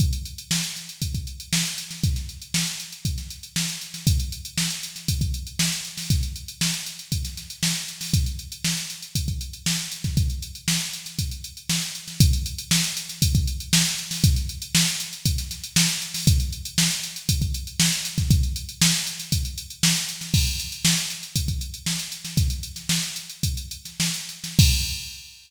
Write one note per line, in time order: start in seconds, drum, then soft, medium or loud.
0.00 kick medium
0.00 closed hi-hat medium
0.13 closed hi-hat medium
0.25 closed hi-hat medium
0.38 closed hi-hat medium
0.51 snare medium
0.64 closed hi-hat medium
0.76 snare soft
0.76 closed hi-hat medium
0.89 closed hi-hat medium
1.02 kick medium
1.02 closed hi-hat medium
1.15 kick medium
1.15 closed hi-hat medium
1.27 closed hi-hat medium
1.40 closed hi-hat medium
1.53 snare medium
1.65 closed hi-hat medium
1.78 closed hi-hat medium
1.91 snare soft
1.91 closed hi-hat soft
2.03 kick medium
2.03 closed hi-hat medium
2.16 snare soft
2.16 closed hi-hat soft
2.29 closed hi-hat soft
2.42 closed hi-hat medium
2.54 snare medium
2.67 closed hi-hat medium
2.80 closed hi-hat medium
2.92 closed hi-hat medium
3.05 kick medium
3.05 closed hi-hat medium
3.18 snare soft
3.18 closed hi-hat soft
3.30 closed hi-hat medium
3.43 closed hi-hat medium
3.56 snare medium
3.69 snare soft
3.69 closed hi-hat medium
3.81 closed hi-hat medium
3.94 snare soft
3.94 closed hi-hat medium
4.07 kick medium
4.07 closed hi-hat medium
4.20 closed hi-hat medium
4.32 closed hi-hat medium
4.45 closed hi-hat medium
4.58 snare medium
4.70 closed hi-hat medium
4.83 closed hi-hat medium
4.96 snare soft
4.96 closed hi-hat medium
5.08 kick medium
5.08 closed hi-hat medium
5.21 kick medium
5.21 closed hi-hat medium
5.34 closed hi-hat medium
5.47 closed hi-hat medium
5.59 snare medium
5.72 closed hi-hat medium
5.85 closed hi-hat medium
5.97 snare medium
5.97 open hi-hat medium
6.10 kick medium
6.10 closed hi-hat medium
6.23 closed hi-hat medium
6.36 closed hi-hat medium
6.48 closed hi-hat medium
6.61 snare medium
6.74 closed hi-hat medium
6.86 closed hi-hat medium
6.99 closed hi-hat medium
7.12 kick medium
7.12 closed hi-hat medium
7.25 snare soft
7.25 closed hi-hat medium
7.37 snare soft
7.37 closed hi-hat medium
7.50 closed hi-hat medium
7.63 snare medium
7.75 closed hi-hat medium
7.88 closed hi-hat medium
8.01 snare soft
8.01 open hi-hat medium
8.13 kick medium
8.13 closed hi-hat medium
8.26 closed hi-hat medium
8.39 closed hi-hat medium
8.52 closed hi-hat medium
8.64 snare medium
8.77 snare soft
8.77 closed hi-hat medium
8.90 closed hi-hat medium
9.02 closed hi-hat medium
9.15 kick medium
9.15 closed hi-hat medium
9.28 kick medium
9.28 closed hi-hat medium
9.41 closed hi-hat medium
9.53 closed hi-hat medium
9.66 snare medium
9.79 snare soft
9.79 closed hi-hat medium
9.92 closed hi-hat medium
10.04 kick medium
10.04 snare soft
10.04 closed hi-hat medium
10.17 kick medium
10.17 closed hi-hat medium
10.30 closed hi-hat soft
10.42 closed hi-hat medium
10.55 closed hi-hat medium
10.68 snare medium
10.81 closed hi-hat soft
10.93 closed hi-hat medium
11.06 snare soft
11.06 closed hi-hat medium
11.19 kick medium
11.19 closed hi-hat medium
11.31 closed hi-hat medium
11.44 closed hi-hat medium
11.57 closed hi-hat soft
11.69 snare medium
11.82 closed hi-hat medium
11.95 closed hi-hat medium
12.08 snare soft
12.08 closed hi-hat soft
12.20 kick loud
12.20 closed hi-hat loud
12.33 closed hi-hat medium
12.46 closed hi-hat medium
12.58 closed hi-hat medium
12.71 snare loud
12.84 closed hi-hat medium
12.97 closed hi-hat medium
13.09 snare soft
13.09 closed hi-hat medium
13.22 kick medium
13.22 closed hi-hat loud
13.35 kick medium
13.35 closed hi-hat medium
13.47 closed hi-hat medium
13.60 closed hi-hat medium
13.73 snare loud
13.86 closed hi-hat medium
13.98 closed hi-hat medium
14.11 snare medium
14.11 open hi-hat medium
14.24 kick loud
14.24 closed hi-hat loud
14.36 closed hi-hat medium
14.49 closed hi-hat medium
14.62 closed hi-hat medium
14.75 snare loud
14.87 closed hi-hat medium
15.00 closed hi-hat medium
15.13 closed hi-hat medium
15.25 kick medium
15.25 closed hi-hat medium
15.38 snare soft
15.38 closed hi-hat medium
15.51 snare soft
15.51 closed hi-hat medium
15.64 closed hi-hat medium
15.76 snare loud
15.89 closed hi-hat medium
16.02 closed hi-hat medium
16.14 snare medium
16.14 open hi-hat medium
16.27 kick loud
16.27 closed hi-hat loud
16.40 closed hi-hat medium
16.52 closed hi-hat medium
16.65 closed hi-hat medium
16.78 snare loud
16.91 snare soft
16.91 closed hi-hat medium
17.03 closed hi-hat medium
17.16 closed hi-hat medium
17.29 kick medium
17.29 closed hi-hat loud
17.42 kick medium
17.42 closed hi-hat medium
17.54 closed hi-hat medium
17.67 closed hi-hat medium
17.80 snare loud
17.92 snare soft
17.92 closed hi-hat medium
18.05 closed hi-hat medium
18.18 kick medium
18.18 snare soft
18.18 closed hi-hat medium
18.31 kick loud
18.31 closed hi-hat medium
18.43 closed hi-hat medium
18.56 closed hi-hat medium
18.69 closed hi-hat medium
18.81 snare loud
18.94 closed hi-hat medium
19.07 closed hi-hat medium
19.19 snare soft
19.19 closed hi-hat medium
19.32 kick medium
19.32 closed hi-hat medium
19.45 closed hi-hat medium
19.58 closed hi-hat medium
19.70 closed hi-hat medium
19.83 snare loud
19.96 closed hi-hat medium
20.09 closed hi-hat medium
20.21 snare soft
20.21 closed hi-hat medium
20.34 kick medium
20.34 crash medium
20.47 closed hi-hat medium
20.59 snare soft
20.59 closed hi-hat medium
20.72 closed hi-hat medium
20.85 snare loud
20.97 closed hi-hat medium
21.10 closed hi-hat medium
21.23 closed hi-hat medium
21.36 kick medium
21.36 closed hi-hat medium
21.48 kick medium
21.48 closed hi-hat medium
21.61 closed hi-hat medium
21.74 closed hi-hat medium
21.86 snare medium
21.99 closed hi-hat medium
22.12 closed hi-hat medium
22.25 snare soft
22.25 closed hi-hat medium
22.37 kick medium
22.37 closed hi-hat medium
22.50 closed hi-hat medium
22.63 closed hi-hat medium
22.76 snare soft
22.76 closed hi-hat medium
22.89 snare medium
23.03 closed hi-hat medium
23.16 closed hi-hat medium
23.30 closed hi-hat medium
23.43 kick medium
23.43 closed hi-hat medium
23.57 closed hi-hat medium
23.71 closed hi-hat medium
23.85 snare soft
23.85 closed hi-hat medium
24.00 snare medium
24.14 closed hi-hat medium
24.29 closed hi-hat medium
24.44 snare medium
24.44 closed hi-hat medium
24.59 kick loud
24.59 crash loud